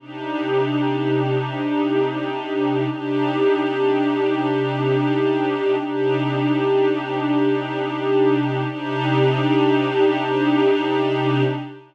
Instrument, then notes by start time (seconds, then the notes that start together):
pad 2 (warm)
0.00 C3 D4 D#4 G4
2.89 C3 D4 D#4 G4
5.78 C3 D4 D#4 G4
8.67 C3 D4 D#4 G4